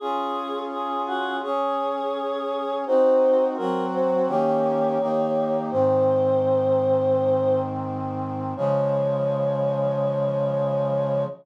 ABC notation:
X:1
M:4/4
L:1/8
Q:1/4=84
K:Db
V:1 name="Choir Aahs"
A2 A G A4 | c2 B c d4 | c6 z2 | d8 |]
V:2 name="Brass Section"
[DFA]4 [DAd]4 | [CEG]2 [G,CG]2 [E,B,D=G]2 [E,B,EG]2 | [A,,E,C]8 | [D,F,A,]8 |]